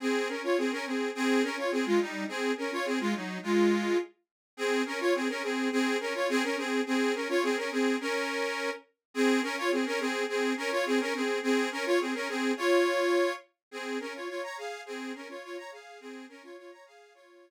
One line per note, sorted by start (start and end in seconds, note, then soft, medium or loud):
0.00 0.28 C4 medium
0.00 0.28 G#4 loud
0.28 0.42 C#4 medium
0.28 0.42 A#4 medium
0.43 0.57 F4 medium
0.43 0.57 C#5 medium
0.58 0.71 C4 medium
0.58 0.71 G#4 medium
0.72 0.85 C#4 medium
0.72 0.85 A#4 loud
0.86 1.10 C4 medium
0.86 1.10 G#4 medium
1.15 1.42 C4 loud
1.15 1.42 G#4 loud
1.43 1.56 C#4 medium
1.43 1.56 A#4 loud
1.57 1.71 F4 medium
1.57 1.71 C#5 medium
1.71 1.85 C4 medium
1.71 1.85 G#4 loud
1.86 1.99 G#3 medium
1.86 1.99 F4 loud
2.00 2.24 G3 medium
2.00 2.24 D#4 medium
2.28 2.52 C4 medium
2.28 2.52 G#4 loud
2.57 2.71 C#4 medium
2.57 2.71 A#4 medium
2.72 2.85 F4 medium
2.72 2.85 C#5 loud
2.85 2.99 C4 medium
2.85 2.99 G#4 loud
3.00 3.13 G#3 medium
3.00 3.13 F4 loud
3.15 3.38 F#3 medium
3.15 3.38 D#4 medium
3.43 3.97 G#3 medium
3.43 3.97 F4 loud
4.57 4.82 C4 loud
4.57 4.82 G#4 loud
4.86 4.99 C#4 medium
4.86 4.99 A#4 loud
5.00 5.13 F4 medium
5.00 5.13 C#5 loud
5.14 5.28 C4 medium
5.14 5.28 G#4 loud
5.29 5.42 C#4 medium
5.29 5.42 A#4 loud
5.43 5.69 C4 medium
5.43 5.69 G#4 loud
5.72 5.97 C4 loud
5.72 5.97 G#4 loud
6.00 6.13 C#4 medium
6.00 6.13 A#4 loud
6.14 6.28 F4 medium
6.14 6.28 C#5 loud
6.29 6.43 C4 loud
6.29 6.43 G#4 loud
6.43 6.56 C#4 medium
6.43 6.56 A#4 loud
6.57 6.81 C4 medium
6.57 6.81 G#4 loud
6.86 7.13 C4 loud
6.86 7.13 G#4 loud
7.14 7.28 C#4 medium
7.14 7.28 A#4 medium
7.29 7.42 F4 loud
7.29 7.42 C#5 loud
7.43 7.56 C4 loud
7.43 7.56 G#4 loud
7.57 7.70 C#4 medium
7.57 7.70 A#4 loud
7.71 7.96 C4 medium
7.71 7.96 G#4 loud
8.00 8.70 C#4 loud
8.00 8.70 A#4 loud
9.14 9.40 C4 loud
9.14 9.40 G#4 loud
9.42 9.56 C#4 loud
9.42 9.56 A#4 loud
9.57 9.71 F4 loud
9.57 9.71 C#5 loud
9.71 9.85 C4 medium
9.71 9.85 G#4 medium
9.86 9.99 C#4 loud
9.86 9.99 A#4 loud
10.00 10.24 C4 loud
10.00 10.24 G#4 loud
10.28 10.53 C4 medium
10.28 10.53 G#4 loud
10.57 10.70 C#4 loud
10.57 10.70 A#4 loud
10.71 10.85 F4 loud
10.71 10.85 C#5 loud
10.86 10.99 C4 loud
10.86 10.99 G#4 loud
11.00 11.14 C#4 loud
11.00 11.14 A#4 loud
11.14 11.39 C4 medium
11.14 11.39 G#4 loud
11.43 11.69 C4 loud
11.43 11.69 G#4 loud
11.72 11.85 C#4 loud
11.72 11.85 A#4 loud
11.85 11.99 F4 loud
11.85 11.99 C#5 loud
12.00 12.14 C4 medium
12.00 12.14 G#4 medium
12.14 12.28 C#4 medium
12.14 12.28 A#4 loud
12.28 12.52 C4 medium
12.28 12.52 G#4 loud
12.57 13.33 F4 loud
12.57 13.33 C#5 loud
13.71 13.98 C4 medium
13.71 13.98 G#4 loud
14.00 14.13 C#4 medium
14.00 14.13 A#4 loud
14.14 14.28 F4 medium
14.14 14.28 C#5 medium
14.28 14.42 F4 medium
14.28 14.42 C#5 medium
14.43 14.57 C#5 medium
14.43 14.57 A#5 loud
14.57 14.81 G#4 medium
14.57 14.81 F5 loud
14.86 15.12 C4 loud
14.86 15.12 G#4 loud
15.14 15.28 C#4 medium
15.14 15.28 A#4 loud
15.29 15.42 F4 medium
15.29 15.42 C#5 medium
15.43 15.57 F4 medium
15.43 15.56 C#5 loud
15.57 15.70 C#5 medium
15.57 15.70 A#5 loud
15.71 15.99 G#4 medium
15.71 15.99 F5 medium
16.00 16.25 C4 loud
16.00 16.25 G#4 loud
16.29 16.42 C#4 loud
16.29 16.42 A#4 loud
16.43 16.56 F4 medium
16.43 16.56 C#5 loud
16.57 16.71 F4 medium
16.57 16.71 C#5 loud
16.71 16.85 C#5 medium
16.71 16.85 A#5 medium
16.86 17.13 G#4 medium
16.86 17.13 F5 loud
17.14 17.50 F4 loud
17.14 17.50 C#5 loud